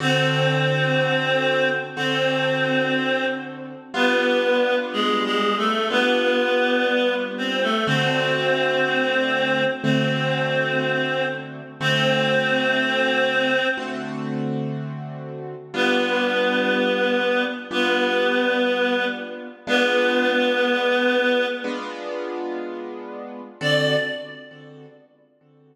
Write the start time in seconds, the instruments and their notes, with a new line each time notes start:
0.00 acoustic grand piano D3 C4 F#4 A4, clarinet C4 C5
1.96 acoustic grand piano D3 C4 F#4 A4, clarinet C4 C5
3.94 acoustic grand piano G3 B3 D4 F4, clarinet B3 B4
4.92 clarinet G#3 G#4
5.24 clarinet G#3 G#4
5.57 clarinet A3 A4
5.90 acoustic grand piano G3 B3 D4 F4, clarinet B3 B4
7.37 clarinet C4 C5
7.62 clarinet A3 A4
7.87 acoustic grand piano D3 A3 C4 F#4, clarinet C4 C5
9.83 acoustic grand piano D3 A3 C4 F#4, clarinet C4 C5
11.80 acoustic grand piano D3 A3 C4 F#4, clarinet C4 C5
13.77 acoustic grand piano D3 A3 C4 F#4
15.74 acoustic grand piano G3 B3 D4 F4, clarinet B3 B4
17.71 acoustic grand piano G3 B3 D4 F4, clarinet B3 B4
19.67 acoustic grand piano G#3 B3 D4 F4, clarinet B3 B4
21.64 acoustic grand piano G#3 B3 D4 F4
23.61 acoustic grand piano D3 C4 F#4 A4, clarinet D5